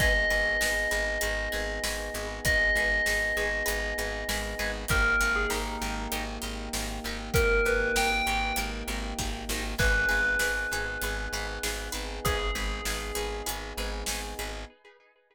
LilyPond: <<
  \new Staff \with { instrumentName = "Tubular Bells" } { \time 4/4 \key gis \minor \tempo 4 = 98 dis''1 | dis''1 | ais'8. gis'16 dis'4 r2 | ais'8 b'8 g''4 r2 |
b'1 | gis'2 r2 | }
  \new Staff \with { instrumentName = "Orchestral Harp" } { \time 4/4 \key gis \minor <dis' gis' b'>8 <dis' gis' b'>8 <dis' gis' b'>8 <dis' gis' b'>8 <dis' gis' b'>8 <dis' gis' b'>8 <dis' gis' b'>8 <dis' gis' b'>8 | <dis' gis' b'>8 <dis' gis' b'>8 <dis' gis' b'>8 <dis' gis' b'>8 <dis' gis' b'>8 <dis' gis' b'>8 <dis' gis' b'>8 <dis' gis' b'>8 | <dis' g' ais'>8 <dis' g' ais'>8 <dis' g' ais'>8 <dis' g' ais'>8 <dis' g' ais'>8 <dis' g' ais'>8 <dis' g' ais'>8 <dis' g' ais'>8 | <dis' g' ais'>8 <dis' g' ais'>8 <dis' g' ais'>8 <dis' g' ais'>8 <dis' g' ais'>8 <dis' g' ais'>8 <dis' g' ais'>8 <dis' g' ais'>8 |
<dis' gis' b'>8 <dis' gis' b'>8 <dis' gis' b'>8 <dis' gis' b'>8 <dis' gis' b'>8 <dis' gis' b'>8 <dis' gis' b'>8 <dis' gis' b'>8 | <dis' gis' b'>8 <dis' gis' b'>8 <dis' gis' b'>8 <dis' gis' b'>8 <dis' gis' b'>8 <dis' gis' b'>8 <dis' gis' b'>8 <dis' gis' b'>8 | }
  \new Staff \with { instrumentName = "Electric Bass (finger)" } { \clef bass \time 4/4 \key gis \minor gis,,8 gis,,8 gis,,8 gis,,8 gis,,8 gis,,8 gis,,8 gis,,8 | gis,,8 gis,,8 gis,,8 gis,,8 gis,,8 gis,,8 gis,,8 gis,,8 | gis,,8 gis,,8 gis,,8 gis,,8 gis,,8 gis,,8 gis,,8 gis,,8 | gis,,8 gis,,8 gis,,8 gis,,8 gis,,8 gis,,8 gis,,8 gis,,8 |
gis,,8 gis,,8 gis,,8 gis,,8 gis,,8 gis,,8 gis,,8 gis,,8 | gis,,8 gis,,8 gis,,8 gis,,8 gis,,8 gis,,8 gis,,8 gis,,8 | }
  \new Staff \with { instrumentName = "Brass Section" } { \time 4/4 \key gis \minor <b dis' gis'>1~ | <b dis' gis'>1 | <ais dis' g'>1~ | <ais dis' g'>1 |
<b dis' gis'>1~ | <b dis' gis'>1 | }
  \new DrumStaff \with { instrumentName = "Drums" } \drummode { \time 4/4 <cymc bd>4 sn4 hh4 sn4 | <hh bd>4 sn4 hh4 sn4 | <hh bd>4 sn4 hh4 sn4 | <hh bd>4 sn4 hh4 <bd sn>8 sn8 |
<cymc bd>4 sn4 hh4 sn4 | <hh bd>4 sn4 hh4 sn4 | }
>>